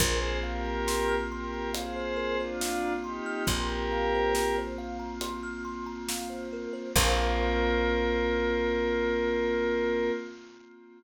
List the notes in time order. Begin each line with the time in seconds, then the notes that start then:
0.00 A#1 A#3 C4 F4 G#4 A#4 C5, kick, closed hi-hat
0.22 C5
0.43 G4 A#4 F5
0.65 A#5
0.87 C6, snare
1.08 F6
1.32 G4 A#4 C6
1.54 A#5
1.73 G#4 C5 F5, closed hi-hat
1.96 C5
2.16 A#4
2.38 D4 F4 C5
2.61 F5, snare
2.83 A#5
3.03 D#4 G4 C6
3.26 F6
3.47 A#1 G4 A#4 C6, kick, closed hi-hat
3.69 A#5
3.92 F5
4.14 C5
4.34 A#4, snare
4.58 C5
4.78 F5
4.99 A#5
5.21 C6, closed hi-hat
5.43 F6
5.65 C6
5.86 A#5
6.09 F5, snare
6.30 C5
6.53 A#4
6.73 C5
6.96 A#1 A#3 C4 F4 A#4 C5 F5, kick, crash